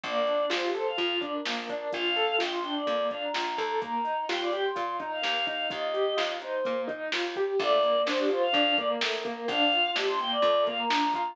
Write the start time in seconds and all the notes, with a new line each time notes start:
0.04 A#1 A#3 D5, kick, closed hi-hat
0.27 D4, closed hi-hat
0.50 A#1 F4 C5, snare
0.63 G4
0.74 A4 C5, closed hi-hat
0.87 F5
0.98 F2 F4, kick, closed hi-hat
1.21 D4 D5, kick, closed hi-hat
1.33 A#4
1.45 A#1 A#3, snare
1.69 D4 A#4, kick, closed hi-hat
1.93 A#1 F4 F5, kick, closed hi-hat
2.16 A4, closed hi-hat
2.38 A#1 F4 G5, snare
2.52 C6
2.63 D4 G5, closed hi-hat
2.75 D5
2.86 F2 A#3, kick, closed hi-hat
3.11 D4 F5, kick, closed hi-hat
3.23 A#5
3.34 A#1 F4, snare
3.58 D#2 A4 A#5, kick, closed hi-hat
3.81 A#3 A#5, kick, closed hi-hat
4.04 D#4, closed hi-hat
4.29 D#2 F4 G5, snare
4.41 D5
4.52 G4 G5, closed hi-hat
4.64 C6
4.75 A#2 F4, kick, closed hi-hat
5.00 D#4 A#5, kick, closed hi-hat
5.12 F5
5.22 D#2 A#3, snare
5.47 D#4 F5, kick, closed hi-hat
5.70 D#2 F4 D#5, kick, closed hi-hat
5.94 G4, closed hi-hat
6.17 D#2 F4, snare
6.41 D#4 C5, closed hi-hat
6.65 A#2 A#3, kick, closed hi-hat
6.88 D#4, kick, closed hi-hat
7.12 D#2 F4, snare
7.36 G4, kick, closed hi-hat
7.59 A#1 A3 D5, kick, closed hi-hat
7.83 A#3, closed hi-hat
8.06 A#1 D4 C5, snare
8.19 G4
8.29 F4 C5, closed hi-hat
8.43 F5
8.53 F2 D4, kick, closed hi-hat
8.77 A#3 D5, kick, closed hi-hat
8.90 A#4
9.01 A#1 A3, snare
9.24 A#3 A#4, kick, closed hi-hat
9.48 A#1 D4 F5, kick, closed hi-hat
9.72 F4, closed hi-hat
9.96 A#1 D4 G4, snare
10.08 C6
10.19 A#3 G5, closed hi-hat
10.31 D5
10.42 F2 A3, kick, closed hi-hat
10.67 A#3 F5, kick, closed hi-hat
10.78 A#5
10.90 A#1 D4, snare
11.14 F4 A#5, kick, closed hi-hat